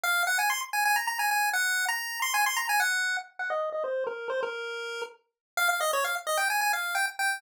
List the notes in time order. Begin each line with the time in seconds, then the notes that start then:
0.03 F5
0.27 F#5
0.39 G#5
0.50 C6
0.73 G#5
0.85 G#5
0.96 A#5
1.07 A#5
1.19 G#5
1.31 G#5
1.53 F#5
1.88 A#5
2.22 C6
2.34 G#5
2.46 C6
2.57 A#5
2.69 G#5
2.80 F#5
3.39 F#5
3.50 D#5
3.72 D#5
3.84 C5
4.07 A#4
4.30 C5
4.43 A#4
5.57 F5
5.69 F5
5.81 D#5
5.93 C#5
6.04 F5
6.27 D#5
6.37 G5
6.50 G#5
6.61 G#5
6.73 F5
6.95 G5
7.19 G5